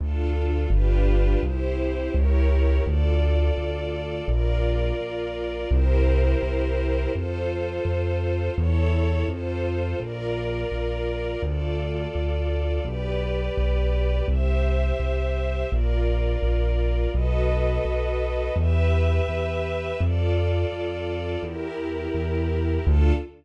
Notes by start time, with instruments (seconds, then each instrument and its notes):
0.00 acoustic grand piano D2, string ensemble 1 D4 F4 A4
0.70 acoustic grand piano G1, string ensemble 1 D4 F4 G4 B4
1.43 acoustic grand piano C2, string ensemble 1 E4 G4 C5
2.14 acoustic grand piano C#2, string ensemble 1 E4 G4 A#4 C#5
2.85 acoustic grand piano D2, string ensemble 1 F4 A4 D5
3.57 acoustic grand piano D2
4.28 acoustic grand piano A#1, string ensemble 1 F4 A#4 D5
5.01 acoustic grand piano A#1
5.71 acoustic grand piano C2, string ensemble 1 E4 G4 A#4 C5
6.43 acoustic grand piano C2
7.14 acoustic grand piano F2, string ensemble 1 F4 A4 C5
7.85 acoustic grand piano F2
8.56 acoustic grand piano E2, string ensemble 1 E4 A4 C#5
9.28 acoustic grand piano F2, string ensemble 1 F4 A4 C5
10.00 acoustic grand piano A#1, string ensemble 1 F4 A#4 D5
10.72 acoustic grand piano A#1
11.42 acoustic grand piano D2, string ensemble 1 F4 A4 D5
12.15 acoustic grand piano D2
12.85 acoustic grand piano B1, string ensemble 1 G4 B4 D5
13.57 acoustic grand piano B1
14.28 acoustic grand piano C2, string ensemble 1 G4 C5 E5
15.00 acoustic grand piano C2
15.70 acoustic grand piano A#1, string ensemble 1 F4 A#4 D5
16.43 acoustic grand piano A#1
17.14 acoustic grand piano B1, string ensemble 1 F#4 A4 B4 D#5
17.85 acoustic grand piano B1
18.56 acoustic grand piano E2, string ensemble 1 G4 B4 E5
19.28 acoustic grand piano E2
20.00 acoustic grand piano F2, string ensemble 1 F4 A4 D5
20.72 acoustic grand piano F2
21.43 acoustic grand piano E2, string ensemble 1 E4 G4 A#4
22.14 acoustic grand piano E2
22.87 acoustic grand piano D2, string ensemble 1 D4 F4 A4